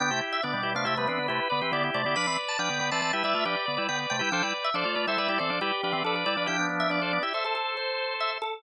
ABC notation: X:1
M:5/4
L:1/16
Q:1/4=139
K:Gmix
V:1 name="Drawbar Organ"
g2 z e d3 f e B B2 B4 d z d2 | b2 z a g3 a a e e2 d4 g z g2 | g2 z e d3 e e d d2 G4 A z d2 | g2 z e d3 e e A A2 c4 e z A2 |]
V:2 name="Drawbar Organ"
[B,D] [EG]3 [B,D]2 [EG] [B,D] [EG] [G,B,] [B,D]2 [EG]2 [Bd] [GB] [EG] [EG]2 [EG] | [Bd] [Bd]3 [Bd]2 [Bd] [Bd] [Bd] [GB] [Bd]2 [GB]2 [Bd] [Bd] [Bd] [Bd]2 [GB] | [Ac] [Bd]3 [Ac]2 [Bd] [Ac] [Bd] [EG] [Ac]2 [Bd]2 [Bd] [Bd] [Bd] [Bd]2 [Bd] | [EG] [B,D] [B,D]2 [B,D] [Ac] [B,D] [EG] [Ac] [Ac]9 z2 |]
V:3 name="Drawbar Organ"
[D,B,] [C,A,] z2 [D,B,] [B,,G,] [B,,G,] [C,A,] [C,A,] [C,A,] [E,C] [D,B,] [C,A,] z [D,B,] [E,C] [D,B,]2 [C,A,] [D,B,] | [F,D] [E,C] z2 [F,D] [D,B,] [D,B,] [E,C] [E,C] [G,E] [G,E] [A,F] [F,D] z [D,B,] [G,E] [D,B,]2 [C,A,] [G,E] | [F,D] [G,E] z2 [F,D] [A,F] [A,F] [G,E] [G,E] [G,E] [E,C] [F,D] [G,E] z [F,D] [E,C] [F,D]2 [G,E] [F,D] | [F,D]8 z12 |]